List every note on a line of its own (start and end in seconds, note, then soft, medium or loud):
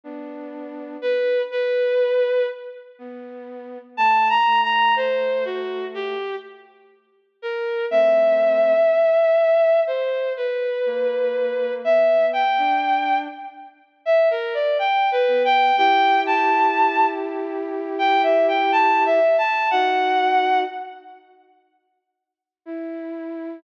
0.04 0.97 B3 medium
0.04 0.97 D4 medium
1.02 1.42 B4 medium
1.51 2.46 B4 medium
2.99 3.78 B3 medium
3.97 4.38 A3 medium
3.97 4.28 A5 medium
4.29 4.60 A#5 medium
4.46 6.15 A3 medium
4.63 4.94 A#5 medium
4.96 5.44 C5 medium
5.45 5.85 F#4 medium
5.94 6.36 G4 medium
7.42 7.85 A#4 medium
7.90 8.73 A3 medium
7.90 8.73 C4 medium
7.90 9.80 E5 medium
9.87 10.33 C5 medium
10.36 11.73 B4 medium
10.86 11.81 A#3 medium
11.84 12.44 B3 medium
11.84 12.26 E5 medium
12.33 13.18 G5 medium
12.58 13.28 D4 medium
14.05 14.29 E5 medium
14.30 14.54 A#4 medium
14.54 14.77 D5 medium
14.79 15.10 G5 medium
15.11 15.43 B4 medium
15.28 15.71 B3 medium
15.45 15.76 G5 medium
15.77 19.19 E4 medium
15.77 19.19 G4 medium
15.77 16.20 G5 medium
16.26 17.06 A5 medium
17.98 18.22 G5 medium
18.23 18.46 E5 medium
18.48 18.71 G5 medium
18.72 19.03 A5 medium
19.05 19.36 E5 medium
19.38 19.69 A5 medium
19.70 20.64 D#4 medium
19.70 20.64 F#4 medium
19.70 20.59 F#5 medium
22.66 23.59 E4 medium